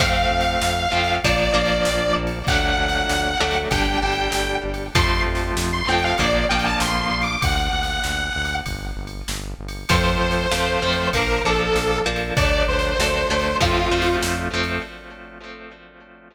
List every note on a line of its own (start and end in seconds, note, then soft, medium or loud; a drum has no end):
0.00 0.26 F2 medium
0.00 0.86 F3 medium
0.00 0.86 A3 loud
0.00 0.86 C4 medium
0.00 1.14 F5 loud
0.00 kick medium
0.00 ride loud
0.31 0.57 F2 medium
0.40 snare medium
0.40 ride medium
0.61 0.88 F2 medium
0.61 snare loud
0.92 1.19 F2 medium
0.92 1.20 F3 medium
0.92 1.20 A3 medium
0.92 1.20 C4 medium
1.03 ride medium
1.23 1.50 A#1 medium
1.23 1.53 F3 loud
1.23 1.53 A#3 medium
1.23 1.53 D4 loud
1.23 1.52 D5 medium
1.23 kick medium
1.23 ride loud
1.54 1.81 A#1 medium
1.54 2.39 F3 medium
1.54 2.39 A#3 medium
1.54 2.39 D4 medium
1.54 2.13 D5 medium
1.66 ride medium
1.85 2.12 A#1 medium
1.85 snare loud
2.16 2.43 A#1 medium
2.27 ride medium
2.47 2.74 D2 medium
2.47 3.34 F#3 loud
2.47 3.34 A3 medium
2.47 3.34 D4 loud
2.47 3.55 F#5 loud
2.47 kick loud
2.47 ride medium
2.78 3.04 D2 medium
2.88 snare medium
2.88 ride medium
3.09 3.36 D2 medium
3.09 snare loud
3.40 3.67 D2 medium
3.40 3.69 F#3 medium
3.40 3.69 A3 medium
3.40 3.69 D4 medium
3.51 ride medium
3.70 3.97 G1 medium
3.70 4.00 G3 loud
3.70 4.00 D4 loud
3.70 3.97 G5 medium
3.70 kick medium
3.70 ride loud
4.02 4.28 G1 medium
4.02 4.88 G3 medium
4.02 4.88 D4 medium
4.02 4.55 G5 medium
4.12 ride medium
4.32 4.59 G1 medium
4.32 snare loud
4.64 4.90 G1 medium
4.74 ride medium
4.94 5.21 F2 medium
4.94 5.81 F3 medium
4.94 5.81 A3 medium
4.94 5.81 C4 medium
4.94 5.20 C6 medium
4.94 kick loud
4.94 ride loud
5.26 5.52 F2 medium
5.35 snare medium
5.35 ride medium
5.56 5.83 F2 medium
5.56 snare loud
5.72 5.87 C6 medium
5.88 6.14 F2 medium
5.88 6.17 F3 medium
5.88 6.17 A3 medium
5.88 6.17 C4 medium
5.88 6.02 G5 medium
5.98 ride medium
6.04 6.18 F5 medium
6.18 6.45 A#1 medium
6.18 6.47 F3 medium
6.18 6.47 A#3 loud
6.18 6.47 D4 loud
6.18 6.43 D5 medium
6.18 kick medium
6.18 ride medium
6.49 6.76 A#1 medium
6.49 7.36 F3 medium
6.49 7.36 A#3 medium
6.49 7.36 D4 medium
6.49 6.64 G5 medium
6.59 ride medium
6.65 6.79 A5 medium
6.80 7.07 A#1 medium
6.80 7.01 C6 medium
6.80 snare loud
7.01 7.21 C6 medium
7.11 7.37 A#1 medium
7.22 7.41 D6 medium
7.22 ride medium
7.42 7.69 D2 medium
7.42 8.55 F#5 medium
7.42 kick loud
7.42 ride loud
7.73 7.99 D2 medium
7.83 snare medium
7.83 ride medium
8.04 8.31 D2 medium
8.04 snare medium
8.35 8.62 D2 medium
8.45 ride medium
8.66 8.93 G1 medium
8.66 kick medium
8.66 ride medium
8.97 9.23 G1 medium
9.07 ride medium
9.28 9.54 G1 medium
9.28 snare loud
9.59 9.85 G1 medium
9.68 ride medium
9.89 10.16 F2 medium
9.89 10.46 F3 loud
9.89 10.46 A3 medium
9.89 10.46 C4 loud
9.89 11.07 C5 medium
9.89 kick medium
9.89 ride loud
10.21 10.47 F2 medium
10.31 snare medium
10.31 ride medium
10.51 10.78 F2 medium
10.51 10.80 F3 medium
10.51 10.80 A3 medium
10.51 10.80 C4 medium
10.51 snare loud
10.82 11.09 F2 medium
10.82 11.11 F3 medium
10.82 11.11 A3 medium
10.82 11.11 C4 medium
10.92 ride medium
11.13 11.40 A#1 medium
11.13 11.42 F3 loud
11.13 11.42 A#3 loud
11.13 11.42 D4 medium
11.13 11.41 A#4 medium
11.13 kick medium
11.13 ride loud
11.44 11.70 A#1 medium
11.44 12.02 F3 medium
11.44 12.02 A#3 medium
11.44 12.02 D4 medium
11.44 11.98 A4 medium
11.54 ride medium
11.75 12.02 A#1 medium
11.75 snare medium
12.06 12.32 A#1 medium
12.06 12.34 F3 medium
12.06 12.34 A#3 medium
12.06 12.34 D4 medium
12.16 ride medium
12.37 12.63 D2 medium
12.37 12.94 F#3 loud
12.37 12.94 A3 medium
12.37 12.94 D4 loud
12.37 12.62 D5 loud
12.37 kick loud
12.37 ride loud
12.68 12.94 D2 medium
12.68 13.56 C5 medium
12.79 snare medium
12.79 ride medium
12.99 13.25 D2 medium
12.99 13.28 F#3 medium
12.99 13.28 A3 medium
12.99 13.28 D4 medium
12.99 snare loud
13.30 13.56 D2 medium
13.30 13.59 F#3 medium
13.30 13.59 A3 medium
13.30 13.59 D4 medium
13.40 ride medium
13.60 13.87 F2 medium
13.60 13.89 F3 medium
13.60 13.89 A3 medium
13.60 13.89 C4 loud
13.60 14.15 F4 medium
13.60 kick medium
13.60 ride medium
13.91 14.17 F2 medium
13.91 14.48 F3 medium
13.91 14.48 A3 medium
13.91 14.48 C4 medium
14.02 ride medium
14.22 14.49 F2 medium
14.22 snare loud
14.53 14.79 F2 medium
14.53 14.82 F3 medium
14.53 14.82 A3 medium
14.53 14.82 C4 medium
14.63 ride medium